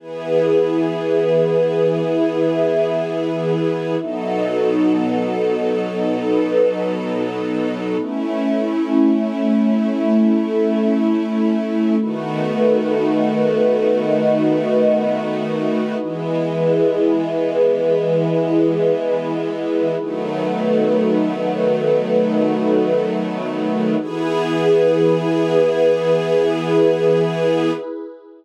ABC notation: X:1
M:4/4
L:1/8
Q:1/4=60
K:E
V:1 name="String Ensemble 1"
[E,B,G]8 | [B,,F,DA]8 | [A,CE]8 | [D,A,B,F]8 |
[E,G,B,]8 | [D,F,A,B,]8 | [E,B,G]8 |]
V:2 name="Pad 2 (warm)"
[EGB]4 [EBe]4 | [B,DFA]4 [B,DAB]4 | [A,CE]4 [A,EA]4 | [DFAB]4 [DFBd]4 |
[EGB]8 | [DFAB]8 | [EGB]8 |]